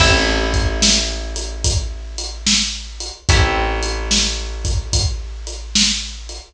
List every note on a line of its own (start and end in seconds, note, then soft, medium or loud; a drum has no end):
0.00 3.11 A1 loud
0.00 3.23 C4 medium
0.00 3.23 E4 medium
0.00 3.23 G4 medium
0.00 3.23 A4 loud
0.00 kick loud
0.00 crash loud
0.54 kick medium
0.54 closed hi-hat medium
0.82 snare loud
1.36 closed hi-hat medium
1.64 kick medium
1.64 closed hi-hat loud
2.18 closed hi-hat medium
2.47 snare loud
3.00 closed hi-hat medium
3.29 6.40 A1 loud
3.29 6.53 C4 medium
3.29 6.53 E4 medium
3.29 6.53 G4 medium
3.29 6.53 A4 medium
3.29 kick loud
3.29 closed hi-hat loud
3.83 closed hi-hat medium
4.11 snare loud
4.65 kick medium
4.65 closed hi-hat medium
4.93 kick medium
4.93 closed hi-hat loud
5.47 closed hi-hat medium
5.75 snare loud
6.29 closed hi-hat medium